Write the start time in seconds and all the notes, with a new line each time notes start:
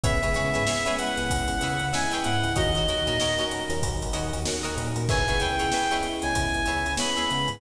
0.04 C#2 G#3 B3 C#4 E4 G#4 B4 C#5 E5, kick, closed hi-hat
0.22 C#3 G#3 B3 C#4 E4 G#4 B4 C#5 E5, closed hi-hat
0.34 C#3 G#4 B4 C#5 E5, closed hi-hat
0.54 G#2 G#4 B4 C#5 E5, closed hi-hat
0.67 G#4 B4 C#5 E5, snare
0.86 G#3 B3 C#4 E4 G#4 B4 C#5 E5, closed hi-hat
0.97 F#5, closed hi-hat
1.17 C#2 G#3 B3 C#4 E4, snare, closed hi-hat
1.30 C#2, kick, closed hi-hat
1.48 snare, closed hi-hat
1.61 C#3 G#4 B4 C#5 E5, closed hi-hat
1.79 C#3, closed hi-hat
1.93 G#3 B3 C#4 E4 G#4 B4 C#5 E5 G#5, snare
2.11 G#4 B4 C#5 E5 G5, closed hi-hat
2.24 G#2 G#3 B3 C#4 E4 F#5, closed hi-hat
2.44 C#2, closed hi-hat
2.56 D#2 F#3 A#3 C#4 D#4 F#4 A#4 C#5 D#5, kick, closed hi-hat
2.74 D#3 F#3 A#3 C#4 D#4 F#4 A#4 C#5 D#5, snare, closed hi-hat
2.87 D#2 F#4 A#4 C#5 D#5, closed hi-hat
3.07 A#2 F#4 A#4 C#5 D#5, closed hi-hat
3.20 F#4 A#4 C#5 D#5, snare
3.38 F#3 A#3 C#4 D#4 F#4 A#4 C#5 D#5, closed hi-hat
3.51 snare, closed hi-hat
3.69 D#2 F#3 A#3 C#4 D#4, snare, closed hi-hat
3.83 D#2, kick, closed hi-hat
4.02 closed hi-hat
4.13 D#2 F#4 A#4 C#5 D#5, closed hi-hat
4.33 D#2, closed hi-hat
4.45 F#3 A#3 C#4 D#4 F#4 A#4 C#5 D#5, snare
4.63 F#4 A#4 C#5 D#5, closed hi-hat
4.76 A#2 F#3 A#3 C#4 D#4, closed hi-hat
4.96 A#2, closed hi-hat
5.09 C#2 G#3 B3 C#4 E4 G#4 B4 C#5 E5 G#5, kick, crash
5.28 C#2 G#3 B3 C#4 E4 G#4 B4 C#5 E5, snare, closed hi-hat
5.40 C#2 G#4 B4 C#5 E5 G5, closed hi-hat
5.59 C#2 G#4 B4 C#5 E5, closed hi-hat
5.72 G#4 B4 C#5 E5, snare
5.91 G#3 B3 C#4 E4 G#4 B4 C#5 E5, closed hi-hat
6.03 closed hi-hat
6.22 C#2 G#3 B3 C#4 E4 G#5, snare, closed hi-hat
6.35 C#2, kick, closed hi-hat
6.54 closed hi-hat
6.66 C#2 G#4 B4 C#5 E5, snare, closed hi-hat
6.86 C#2, closed hi-hat
6.97 G#3 B3 C#4 E4 G#4 B4 C#5 E5 B5, snare
7.17 G#4 B4 C#5 E5, closed hi-hat
7.29 C#3 G#3 B3 C#4 E4, snare, closed hi-hat
7.48 G#2, closed hi-hat